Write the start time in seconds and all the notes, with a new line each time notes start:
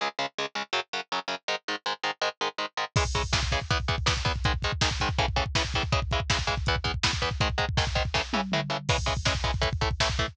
0.01 C#2 C#3 G#3
0.19 C#2 C#3 G#3
0.38 C#2 C#3 G#3
0.55 C#2 C#3 G#3
0.73 F#2 C#3 F#3
0.93 F#2 C#3 F#3
1.12 F#2 C#3 F#3
1.28 F#2 C#3 F#3
1.48 G#2 D#3 G#3
1.68 G#2 D#3 G#3
1.86 G#2 D#3 G#3
2.03 G#2 D#3 G#3
2.21 G#2 D#3 G#3
2.41 G#2 D#3 G#3
2.58 G#2 D#3 G#3
2.77 G#2 D#3 G#3
2.96 C#3 E3 G#3, kick, crash
3.05 kick
3.15 C#3 E3 G#3, kick, closed hi-hat
3.23 kick
3.33 C#3 E3 G#3, kick, snare
3.43 kick
3.52 C#3 E3 G#3, kick, closed hi-hat
3.61 kick
3.71 E2 E3 B3, kick, closed hi-hat
3.80 kick
3.88 E2 E3 B3, kick, closed hi-hat
3.98 kick
4.06 E2 E3 B3, kick, snare
4.17 kick
4.25 E2 E3 B3, kick, closed hi-hat
4.36 kick
4.44 G#2 D#3 G#3, kick, closed hi-hat
4.54 kick
4.62 G#2 D#3 G#3, kick, closed hi-hat
4.72 kick
4.81 G#2 D#3 G#3, kick, snare
4.91 kick
5.00 G#2 D#3 G#3, kick, closed hi-hat
5.09 kick
5.18 A2 C#3 E3, kick, closed hi-hat
5.28 kick
5.36 A2 C#3 E3, kick, closed hi-hat
5.46 kick
5.55 A2 C#3 E3, kick, snare
5.65 kick
5.74 A2 C#3 E3, kick, closed hi-hat
5.83 kick
5.92 C#3 E3 G#3, kick, closed hi-hat
6.02 kick
6.11 C#3 E3 G#3, kick, closed hi-hat
6.20 kick
6.30 C#3 E3 G#3, kick, snare
6.39 kick
6.47 C#3 E3 G#3, kick, closed hi-hat
6.57 kick
6.66 E2 E3 B3, kick, closed hi-hat
6.76 kick
6.84 E2 E3 B3, kick, closed hi-hat
6.94 kick
7.03 E2 E3 B3, kick, snare
7.13 kick
7.22 E2 E3 B3, kick, closed hi-hat
7.31 kick
7.40 G#2 D#3 G#3, kick, closed hi-hat
7.50 kick
7.58 G#2 D#3 G#3, kick, closed hi-hat
7.69 kick
7.77 G#2 D#3 G#3, kick, snare
7.87 kick
7.95 G#2 D#3 G#3, kick, closed hi-hat
8.05 kick
8.14 A2 C#3 E3, kick, snare
8.33 A2 C#3 E3, high tom
8.52 A2 C#3 E3, mid tom
8.70 A2 C#3 E3
8.89 C#3 E3 G#3, kick, crash
8.98 kick
9.06 C#3 E3 G#3, kick, closed hi-hat
9.17 kick
9.25 C#3 E3 G#3, kick, snare
9.35 kick
9.44 C#3 E3 G#3, kick, closed hi-hat
9.54 kick
9.61 A2 E3 A3, kick, closed hi-hat
9.73 kick
9.81 A2 E3 A3, kick, closed hi-hat
9.91 kick
10.00 A2 E3 A3, kick, snare
10.10 kick
10.19 A2 E3 A3, kick, closed hi-hat
10.28 kick